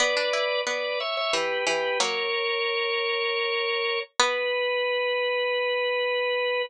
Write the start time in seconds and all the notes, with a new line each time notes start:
0.00 B3 B4 D5
0.17 D4
0.33 E4
0.67 B3 B4 D5
1.00 C#5 E5
1.17 C#5 E5
1.33 E3 G4 B4
1.67 E3 G4 B4
2.00 F#3 A#3 A#4 C#5
4.20 B3 B4